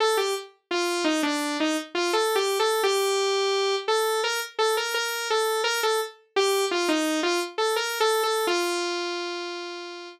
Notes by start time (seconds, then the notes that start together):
0.00 A4
0.17 G4
0.71 F4
1.04 D#4
1.23 D4
1.60 D#4
1.95 F4
2.13 A4
2.35 G4
2.59 A4
2.83 G4
3.88 A4
4.24 A#4
4.59 A4
4.77 A#4
4.94 A#4
5.30 A4
5.64 A#4
5.83 A4
6.36 G4
6.71 F4
6.89 D#4
7.23 F4
7.58 A4
7.76 A#4
8.00 A4
8.23 A4
8.47 F4